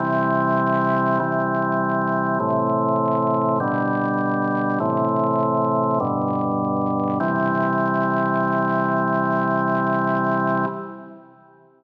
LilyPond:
\new Staff { \clef bass \time 3/4 \key c \major \tempo 4 = 50 <c e g>4 <c e g>4 <a, c e>4 | <b, d g>4 <a, c e>4 <g, b, d>4 | <c e g>2. | }